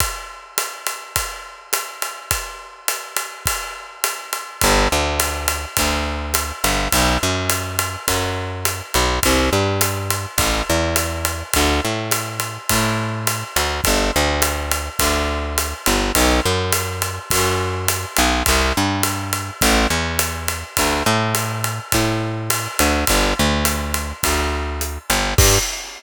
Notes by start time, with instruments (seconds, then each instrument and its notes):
0.00 kick, ride
0.58 hi-hat pedal, ride
0.87 ride
1.16 kick, ride
1.73 hi-hat pedal, ride
2.02 ride
2.31 kick, ride
2.88 hi-hat pedal, ride
3.16 ride
3.46 kick, ride
4.04 hi-hat pedal, ride
4.33 ride
4.61 electric bass (finger) G1, kick, ride
4.92 electric bass (finger) D2
5.20 hi-hat pedal, ride
5.48 ride
5.77 electric bass (finger) D2, kick, ride
6.34 hi-hat pedal, ride
6.64 electric bass (finger) G1, ride
6.92 electric bass (finger) B1, kick, ride
7.23 electric bass (finger) F#2
7.50 hi-hat pedal, ride
7.79 ride
8.08 electric bass (finger) F#2, kick, ride
8.65 hi-hat pedal, ride
8.94 electric bass (finger) B1, ride
9.23 electric bass (finger) C2, kick, ride
9.53 electric bass (finger) G2
9.81 hi-hat pedal, ride
10.10 ride
10.38 electric bass (finger) A1, kick, ride
10.70 electric bass (finger) E2
10.96 hi-hat pedal, ride
11.25 ride
11.53 electric bass (finger) D2, kick, ride
11.84 electric bass (finger) A2
12.11 hi-hat pedal, ride
12.40 ride
12.69 electric bass (finger) A2, kick, ride
13.27 hi-hat pedal, ride
13.56 electric bass (finger) D2, ride
13.84 electric bass (finger) G1, kick, ride
14.16 electric bass (finger) D2
14.42 hi-hat pedal, ride
14.71 ride
14.99 electric bass (finger) D2, kick, ride
15.58 hi-hat pedal, ride
15.86 electric bass (finger) G1, ride
16.15 electric bass (finger) B1, kick, ride
16.45 electric bass (finger) F#2
16.72 hi-hat pedal, ride
17.02 ride
17.30 electric bass (finger) F#2, kick, ride
17.88 hi-hat pedal, ride
18.16 electric bass (finger) B1, hi-hat pedal, ride
18.46 electric bass (finger) C2, kick, ride
18.77 electric bass (finger) G2
19.03 hi-hat pedal, ride
19.33 ride
19.61 electric bass (finger) A1, kick, ride
19.90 electric bass (finger) E2
20.19 hi-hat pedal, ride
20.48 ride
20.77 electric bass (finger) D2, kick, ride
21.06 electric bass (finger) A2
21.35 hi-hat pedal, ride
21.64 ride
21.92 electric bass (finger) A2, kick, ride
22.50 hi-hat pedal, ride
22.79 electric bass (finger) D2, ride
23.07 electric bass (finger) G1, kick, ride
23.39 electric bass (finger) D2
23.65 hi-hat pedal, ride
23.94 ride
24.23 electric bass (finger) D2, kick, ride
24.81 hi-hat pedal
25.10 electric bass (finger) G1, ride
25.38 electric bass (finger) G2, kick, crash